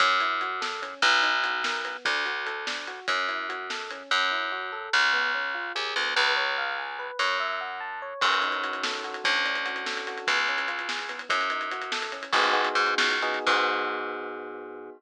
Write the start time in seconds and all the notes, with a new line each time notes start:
0.00 F#2 C#4, kick, closed hi-hat
0.20 E4, closed hi-hat
0.41 F#4, closed hi-hat
0.61 A4, snare
0.82 C#4, closed hi-hat
1.02 B1 B3, kick, closed hi-hat
1.23 D#4, closed hi-hat
1.44 F#4, closed hi-hat
1.64 A#4, snare
1.85 B3, closed hi-hat
2.05 D2 D4, kick, closed hi-hat
2.26 F#4, closed hi-hat
2.46 A4, closed hi-hat
2.67 D4, snare
2.88 F#4, closed hi-hat
3.08 F#2 C#4, kick, closed hi-hat
3.29 E4, closed hi-hat
3.49 F#4, closed hi-hat
3.70 A4, snare
3.90 C#4, closed hi-hat
4.11 F#2 C#4
4.31 E4
4.52 F#4
4.72 A4
4.93 C#2 C#4
5.13 B3
5.35 C#4
5.54 F4
5.75 D#2 G#4
5.96 D2 B3
6.16 C#2 B4
6.37 C#5
6.58 F5
6.78 G#5
6.99 B4
7.19 F#2 C#5
7.40 E5
7.61 F#5
7.80 A5
8.02 C#5
8.21 F#2 C#4, kick, crash
8.32 closed hi-hat
8.42 D#4, closed hi-hat
8.52 closed hi-hat
8.63 F#4, closed hi-hat
8.73 closed hi-hat
8.83 A4, snare
8.94 closed hi-hat
9.04 F#4, closed hi-hat
9.14 closed hi-hat
9.24 D2 C#4, kick, closed hi-hat
9.35 closed hi-hat
9.45 D4, closed hi-hat
9.55 closed hi-hat
9.65 F#4, closed hi-hat
9.76 closed hi-hat
9.86 A4, snare
9.97 closed hi-hat
10.07 F#4, closed hi-hat
10.18 closed hi-hat
10.27 C#2 B3, kick, closed hi-hat
10.38 closed hi-hat
10.48 C#4, closed hi-hat
10.58 closed hi-hat
10.68 F4, closed hi-hat
10.79 closed hi-hat
10.89 G#4, snare
10.99 closed hi-hat
11.09 B3, closed hi-hat
11.19 closed hi-hat
11.29 F#2 C#4, kick, closed hi-hat
11.41 closed hi-hat
11.50 D#4, closed hi-hat
11.61 closed hi-hat
11.71 F#4, closed hi-hat
11.82 closed hi-hat
11.92 A4, snare
12.02 closed hi-hat
12.12 C#4, closed hi-hat
12.23 closed hi-hat
12.33 G#1 B3 D#4 F#4 G#4, kick, crash
12.43 closed hi-hat
12.53 B3 D#4 F#4 G#4, closed hi-hat
12.65 closed hi-hat
12.75 G#2, closed hi-hat
12.87 closed hi-hat
12.98 C#2, snare
13.10 closed hi-hat
13.22 B3 D#4 F#4 G#4, closed hi-hat
13.34 closed hi-hat
13.47 G#2 B3 D#4 F#4 G#4, kick, crash